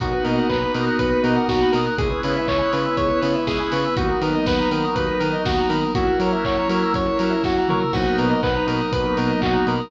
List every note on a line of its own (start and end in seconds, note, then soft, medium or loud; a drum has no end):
0.00 0.14 B1 loud
0.00 1.78 A#3 loud
0.00 1.96 A#3 medium
0.00 1.78 B3 loud
0.00 1.96 B3 medium
0.00 1.78 D#4 loud
0.00 1.96 D#4 medium
0.00 1.78 F#4 loud
0.00 1.96 F#4 medium
0.00 0.24 F#4 medium
0.00 0.11 A#4 medium
0.00 kick loud
0.00 closed hi-hat loud
0.13 0.24 B4 medium
0.24 0.39 B2 medium
0.24 0.47 A#4 medium
0.24 0.35 D#5 medium
0.24 open hi-hat medium
0.36 0.48 F#5 medium
0.49 0.64 B1 medium
0.49 0.72 B4 medium
0.49 0.61 A#5 medium
0.49 kick loud
0.49 clap loud
0.63 0.74 B5 medium
0.74 0.88 B2 medium
0.74 0.98 A#4 medium
0.74 0.86 D#6 medium
0.74 open hi-hat loud
0.85 0.96 F#6 medium
0.98 1.13 B1 medium
0.98 1.09 A#4 medium
0.98 1.22 B4 medium
0.98 kick loud
0.98 closed hi-hat loud
1.10 1.21 B4 medium
1.23 1.37 B2 medium
1.23 1.47 A#4 medium
1.23 1.34 D#5 medium
1.23 open hi-hat medium
1.36 1.47 F#5 medium
1.48 1.62 B1 medium
1.48 1.72 F#4 medium
1.48 1.60 A#5 medium
1.48 kick loud
1.48 snare loud
1.62 1.73 B5 medium
1.72 1.88 B2 medium
1.72 1.95 A#4 medium
1.72 1.86 D#6 medium
1.72 open hi-hat loud
1.86 1.97 F#6 medium
1.98 2.12 C#2 loud
1.98 3.95 G#3 medium
1.98 3.78 G#3 medium
1.98 3.95 B3 medium
1.98 3.78 B3 loud
1.98 3.95 C#4 medium
1.98 3.78 C#4 medium
1.98 3.95 E4 medium
1.98 3.78 E4 medium
1.98 2.09 G#4 medium
1.98 2.21 G#4 medium
1.98 kick loud
1.98 closed hi-hat loud
2.09 2.20 B4 medium
2.23 2.38 C#3 medium
2.23 2.47 B4 medium
2.23 2.35 C#5 medium
2.23 open hi-hat loud
2.36 2.48 E5 medium
2.46 2.62 C#2 medium
2.46 2.71 C#5 loud
2.46 2.58 G#5 medium
2.46 kick loud
2.46 clap loud
2.59 2.70 B5 medium
2.71 2.87 C#3 medium
2.71 2.96 B4 medium
2.71 2.83 C#6 medium
2.71 open hi-hat loud
2.86 2.97 E6 medium
2.97 3.12 C#2 medium
2.97 3.08 G#4 medium
2.97 3.20 C#5 medium
2.97 kick loud
2.97 closed hi-hat loud
3.10 3.21 B4 medium
3.21 3.36 C#3 medium
3.21 3.44 B4 medium
3.21 3.35 C#5 medium
3.21 open hi-hat loud
3.35 3.46 E5 medium
3.47 3.61 C#2 medium
3.47 3.70 G#4 loud
3.47 3.58 G#5 medium
3.47 kick loud
3.47 snare loud
3.60 3.71 B5 medium
3.72 3.86 C#3 loud
3.72 3.95 B4 medium
3.72 3.84 C#6 medium
3.72 open hi-hat loud
3.85 3.96 E6 medium
3.95 4.11 D#2 loud
3.95 5.75 F#3 loud
3.95 5.93 F#3 loud
3.95 5.75 A#3 medium
3.95 5.93 A#3 medium
3.95 5.75 B3 medium
3.95 5.93 B3 medium
3.95 5.75 D#4 loud
3.95 5.93 D#4 medium
3.95 4.06 F#4 medium
3.95 4.20 F#4 medium
3.95 kick loud
3.95 closed hi-hat loud
4.09 4.20 A#4 medium
4.21 4.35 D#3 medium
4.21 4.45 A#4 medium
4.21 4.33 B4 medium
4.21 open hi-hat loud
4.35 4.46 D#5 medium
4.46 4.60 D#2 medium
4.46 4.70 B4 loud
4.46 4.58 F#5 medium
4.46 kick loud
4.46 snare loud
4.59 4.71 A#5 medium
4.71 4.85 D#3 medium
4.71 4.94 A#4 medium
4.71 4.82 B5 medium
4.71 open hi-hat loud
4.85 4.96 D#6 medium
4.95 5.09 D#2 medium
4.95 5.06 F#4 medium
4.95 5.18 B4 medium
4.95 kick loud
4.95 closed hi-hat loud
5.09 5.20 A#4 medium
5.19 5.34 D#3 medium
5.19 5.43 A#4 medium
5.19 5.30 B4 medium
5.19 open hi-hat loud
5.33 5.44 D#5 medium
5.45 5.59 D#2 medium
5.45 5.68 F#4 medium
5.45 5.58 F#5 medium
5.45 kick loud
5.45 snare loud
5.59 5.70 A#5 medium
5.69 5.84 D#3 medium
5.69 5.92 A#4 medium
5.69 5.80 B5 medium
5.69 open hi-hat loud
5.81 5.92 D#6 medium
5.95 6.08 F#2 loud
5.95 7.74 F#3 loud
5.95 7.91 F#3 medium
5.95 7.74 A#3 loud
5.95 7.91 A#3 medium
5.95 7.74 C#4 medium
5.95 7.92 C#4 medium
5.95 7.74 E4 loud
5.95 7.92 E4 medium
5.95 6.18 F#4 loud
5.95 6.07 F#4 medium
5.95 kick loud
5.95 closed hi-hat loud
6.07 6.18 A#4 medium
6.19 6.33 F#3 medium
6.19 6.44 A#4 medium
6.19 6.31 C#5 medium
6.19 open hi-hat loud
6.32 6.43 E5 medium
6.45 6.58 F#2 medium
6.45 6.68 C#5 medium
6.45 6.57 F#5 medium
6.45 kick loud
6.45 clap loud
6.57 6.68 A#5 medium
6.69 6.83 F#3 medium
6.69 6.93 A#4 medium
6.69 6.81 C#6 medium
6.69 open hi-hat loud
6.83 6.95 E6 medium
6.94 7.07 F#2 medium
6.94 7.06 F#4 medium
6.94 7.18 C#5 medium
6.94 kick loud
6.94 closed hi-hat loud
7.06 7.17 A#4 medium
7.19 7.33 F#3 medium
7.19 7.42 A#4 medium
7.19 7.30 C#5 medium
7.19 open hi-hat loud
7.30 7.41 E5 medium
7.43 7.57 F#2 loud
7.43 7.68 F#4 medium
7.43 7.56 F#5 medium
7.43 kick loud
7.43 snare loud
7.57 7.68 A#5 medium
7.68 7.83 F#3 medium
7.68 7.93 A#4 medium
7.68 7.81 C#6 medium
7.68 mid tom loud
7.80 7.91 E6 medium
7.92 8.07 B1 loud
7.92 9.88 F#3 medium
7.92 9.73 F#3 medium
7.92 9.88 A#3 medium
7.92 9.73 A#3 loud
7.92 9.88 B3 medium
7.92 9.73 B3 loud
7.92 9.88 D#4 medium
7.92 9.73 D#4 loud
7.92 8.16 F#4 loud
7.92 8.05 F#4 medium
7.92 kick loud
7.92 crash loud
8.06 8.17 A#4 medium
8.18 8.32 B2 medium
8.18 8.41 A#4 medium
8.18 8.29 B4 medium
8.18 open hi-hat medium
8.30 8.41 D#5 medium
8.43 8.57 B1 loud
8.43 8.66 B4 medium
8.43 8.54 F#5 medium
8.43 kick loud
8.43 clap loud
8.55 8.66 A#5 medium
8.67 8.81 B2 medium
8.67 8.91 A#4 medium
8.67 8.79 B5 medium
8.67 open hi-hat loud
8.81 8.92 D#6 medium
8.92 9.06 B1 medium
8.92 9.04 F#4 medium
8.92 9.15 B4 medium
8.92 kick loud
8.92 closed hi-hat loud
9.06 9.17 A#4 medium
9.17 9.31 B2 medium
9.17 9.40 A#4 medium
9.17 9.30 B4 medium
9.17 open hi-hat loud
9.29 9.40 D#5 medium
9.41 9.56 B1 medium
9.41 9.66 F#4 medium
9.41 9.52 F#5 medium
9.41 kick loud
9.41 clap loud
9.53 9.64 A#5 medium
9.67 9.80 B2 medium
9.67 9.90 A#4 medium
9.67 9.79 B5 medium
9.67 open hi-hat medium
9.79 9.90 D#6 medium